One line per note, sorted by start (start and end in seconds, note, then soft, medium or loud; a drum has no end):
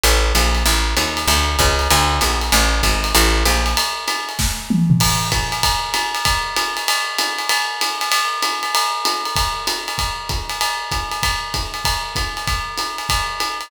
0.03 0.33 A1 medium
0.03 ride medium
0.35 0.64 A#1 medium
0.35 hi-hat pedal medium
0.35 ride medium
0.55 ride medium
0.66 0.94 A1 medium
0.66 ride medium
0.97 1.26 D#2 medium
0.97 hi-hat pedal medium
0.97 ride medium
1.17 ride medium
1.27 1.56 D2 medium
1.27 ride medium
1.59 1.88 C#2 medium
1.59 kick medium
1.59 hi-hat pedal medium
1.59 ride medium
1.79 ride medium
1.90 2.20 D2 medium
1.90 ride medium
2.21 2.50 A#1 medium
2.21 hi-hat pedal medium
2.21 ride medium
2.41 ride medium
2.52 2.81 A1 medium
2.52 ride medium
2.83 3.12 G#1 medium
2.83 kick soft
2.83 hi-hat pedal medium
2.83 ride medium
3.04 ride medium
3.15 3.44 A1 medium
3.15 ride medium
3.45 3.74 A#1 medium
3.45 hi-hat pedal medium
3.45 ride medium
3.66 ride medium
3.77 ride loud
4.08 hi-hat pedal medium
4.08 ride medium
4.29 ride medium
4.39 kick medium
4.39 snare medium
4.70 mid tom medium
4.90 floor tom medium
5.00 kick medium
5.00 crash medium
5.00 ride loud
5.32 kick medium
5.32 hi-hat pedal medium
5.32 ride medium
5.52 ride medium
5.63 kick medium
5.63 ride loud
5.94 hi-hat pedal medium
5.94 ride medium
6.15 ride medium
6.25 kick medium
6.25 ride medium
6.56 hi-hat pedal medium
6.56 ride medium
6.77 ride medium
6.88 ride loud
7.18 hi-hat pedal medium
7.18 ride medium
7.38 ride medium
7.49 ride loud
7.81 hi-hat pedal medium
7.81 ride medium
8.01 ride medium
8.12 ride loud
8.42 hi-hat pedal medium
8.42 ride medium
8.63 ride medium
8.75 ride loud
9.05 hi-hat pedal medium
9.05 ride medium
9.25 ride medium
9.36 kick medium
9.36 ride medium
9.67 hi-hat pedal medium
9.67 ride medium
9.88 ride medium
9.98 kick soft
9.98 ride medium
10.29 kick medium
10.29 hi-hat pedal medium
10.29 ride medium
10.49 ride medium
10.61 ride medium
10.91 kick soft
10.91 hi-hat pedal medium
10.91 ride medium
11.11 ride medium
11.23 kick medium
11.23 ride medium
11.54 kick medium
11.54 hi-hat pedal medium
11.54 ride medium
11.74 ride medium
11.85 kick medium
11.85 ride medium
12.15 kick medium
12.15 hi-hat pedal medium
12.15 ride medium
12.37 ride medium
12.47 kick medium
12.47 ride medium
12.78 hi-hat pedal medium
12.78 ride medium
12.98 ride medium
13.09 kick medium
13.09 ride medium
13.40 hi-hat pedal medium
13.40 ride medium
13.61 ride medium